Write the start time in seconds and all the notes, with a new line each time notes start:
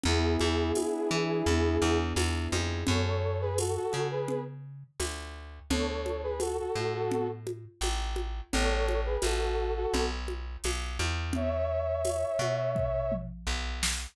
0.04 E2 B3 E4 G#4, low conga
0.40 E2 D4, high conga
0.75 E4, tambourine, high conga
1.11 E3 G#4
1.46 E2 B3, low conga
1.81 E2 D4
2.16 E2 E4, tambourine, high conga
2.52 F2 G#4, high conga
2.87 F#2 A4 C#5, low conga
3.06 A4 C#5
3.41 G#4 B4
3.58 F#4 A4, tambourine, high conga
3.76 F#4 A4
3.93 C#3, high conga
4.11 G#4 B4
4.28 low conga
5.00 D2, tambourine, high conga
5.70 D2 A4 C#5, low conga
5.88 A4 C#5
6.06 high conga
6.23 G#4 B4
6.40 F#4 A4, tambourine, high conga
6.59 F#4 A4
6.75 A2, high conga
6.94 F#4 A4
7.11 low conga
7.47 high conga
7.81 A1, tambourine, high conga
8.16 high conga
8.52 A1 A4 C#5, low conga
8.70 A4 C#5
8.89 high conga
9.06 G#4 B4
9.22 A1 F#4 A4, tambourine, high conga
9.41 F#4 A4
9.76 F#4 A4
9.94 B1, low conga
10.28 high conga
10.64 B1, tambourine, high conga
10.99 E2, high conga
11.33 C#5 E5, low conga
12.05 tambourine, high conga
12.39 B2, high conga
12.75 kick, floor tom
13.12 mid tom
13.47 B1
13.83 snare